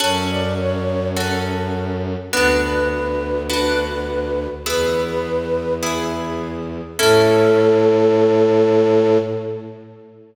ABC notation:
X:1
M:4/4
L:1/8
Q:1/4=103
K:A
V:1 name="Flute"
c d c2 z4 | B B B2 B4 | B4 z4 | A8 |]
V:2 name="Orchestral Harp"
[CFA]4 [CFA]4 | [B,DF]4 [B,DF]4 | [B,EG]4 [B,EG]4 | [CEA]8 |]
V:3 name="Violin" clef=bass
F,,8 | D,,8 | E,,8 | A,,8 |]